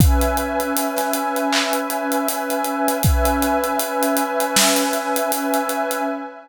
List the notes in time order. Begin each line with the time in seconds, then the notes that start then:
0.00 C#4 B4 E5 G#5, kick, closed hi-hat
0.21 closed hi-hat
0.37 closed hi-hat
0.60 closed hi-hat
0.77 closed hi-hat
0.97 snare, closed hi-hat
1.13 closed hi-hat
1.36 closed hi-hat
1.53 clap
1.73 closed hi-hat
1.90 closed hi-hat
2.12 closed hi-hat
2.28 closed hi-hat
2.50 closed hi-hat
2.64 closed hi-hat
2.88 closed hi-hat
3.03 C#4 B4 E5 G#5, kick, closed hi-hat
3.25 closed hi-hat
3.42 closed hi-hat
3.64 closed hi-hat
3.79 closed hi-hat
4.03 closed hi-hat
4.17 closed hi-hat
4.40 closed hi-hat
4.56 snare
4.76 closed hi-hat
4.93 closed hi-hat
5.16 closed hi-hat
5.32 closed hi-hat
5.54 closed hi-hat
5.69 closed hi-hat
5.91 closed hi-hat